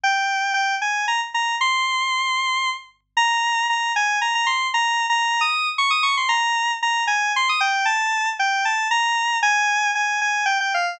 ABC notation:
X:1
M:3/4
L:1/16
Q:1/4=115
K:Fdor
V:1 name="Lead 1 (square)"
g4 g2 a2 b z b2 | c'10 z2 | [K:Bbdor] b4 b2 a2 b b c'2 | (3b4 b4 e'4 d' e' d' c' |
b4 b2 a2 c' e' g2 | =a4 g2 a2 b4 | [K:Fdor] a4 a2 a2 g g f2 |]